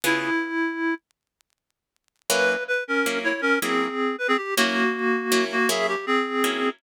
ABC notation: X:1
M:12/8
L:1/16
Q:3/8=106
K:Db
V:1 name="Clarinet"
=E10 z14 | =B4 _c2 [D_B]4 [_Fd]2 [DB]2 [=CA]6 =B [CA] =G2 | [B,G]10 [B,G]2 [A_f]2 =G2 [CA]8 |]
V:2 name="Acoustic Guitar (steel)"
[D,_CFA]24 | [G,B,D_F]8 [G,B,DF]6 [G,B,DF]10 | [G,B,D_F]8 [G,B,DF]4 [G,B,DF]8 [G,B,DF]4 |]